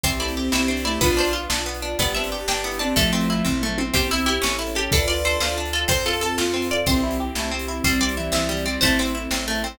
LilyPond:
<<
  \new Staff \with { instrumentName = "Pizzicato Strings" } { \time 6/8 \key c \major \tempo 4. = 123 c''8 d''8 r8 e''4 d''8 | b'8 c''8 r2 | d''8 e''8 r8 g''4 a''8 | a'4 r2 |
g'8 e'8 e'8 r4 g'8 | a'8 d''8 c''8 c''8 r8 a'8 | c''8 a'8 a'8 r4 d''8 | c''4. r4. |
c''8 d''8 r8 e''4 d''8 | c''8 c''8 r2 | }
  \new Staff \with { instrumentName = "Lead 1 (square)" } { \time 6/8 \key c \major e8 a8 c'8 c'8 d'8 a8 | <d' f'>4 r2 | g8 c'8 d'8 d'8 e'8 c'8 | <f a>4. r4. |
g'8 e'4 e'4 r8 | <b' d''>4. d''8 r4 | c''8 a'4 f'4 r8 | <e g>4 r8 a8 r4 |
c'8 g8 e8 e8 e8 g8 | <c' e'>4 r2 | }
  \new Staff \with { instrumentName = "Orchestral Harp" } { \time 6/8 \key c \major c'8 e'8 g'8 e'8 c'8 e'8 | b8 d'8 f'8 d'8 b8 d'8 | b8 d'8 g'8 d'8 b8 d'8 | a8 c'8 e'8 c'8 a8 c'8 |
c'8 e'8 g'8 cis'8 e'8 a'8 | d'8 f'8 a'8 f'8 d'8 f'8 | c'8 f'8 a'8 f'8 c'8 f'8 | c'8 e'8 g'8 e'8 c'8 e'8 |
g8 c'8 e'8 c'8 g8 c'8 | a8 c'8 e'8 c'8 a8 c'8 | }
  \new Staff \with { instrumentName = "Electric Bass (finger)" } { \clef bass \time 6/8 \key c \major c,4. c,4. | b,,4. b,,4. | g,,4. g,,4. | a,,4. a,,4. |
c,4. a,,4. | d,4. d,4. | f,4. f,4. | c,4. c,4. |
c,4. c,4. | a,,4. a,,4. | }
  \new Staff \with { instrumentName = "String Ensemble 1" } { \time 6/8 \key c \major <c' e' g'>2. | <b d' f'>2. | <b d' g'>2. | <a c' e'>2. |
<c' e' g'>4. <cis' e' a'>4. | <d' f' a'>2. | <c' f' a'>2. | <c' e' g'>2. |
<g c' e'>2. | <a c' e'>2. | }
  \new DrumStaff \with { instrumentName = "Drums" } \drummode { \time 6/8 <hh bd>8. hh8. sn8. hh8. | <hh bd>8. hh8. sn8. hh8. | <hh bd>8. hh8. sn8. hh8. | <hh bd>8. hh8. <bd tomfh>8 toml8 tommh8 |
<hh bd>8. hh8. sn8. hh8. | <hh bd>8. hh8. sn8. hh8. | <hh bd>8. hh8. sn8. hh8. | <hh bd>8. hh8. sn8. hh8. |
<hh bd>8. hh8. sn8. hh8. | <hh bd>8. hh8. sn8. hh8. | }
>>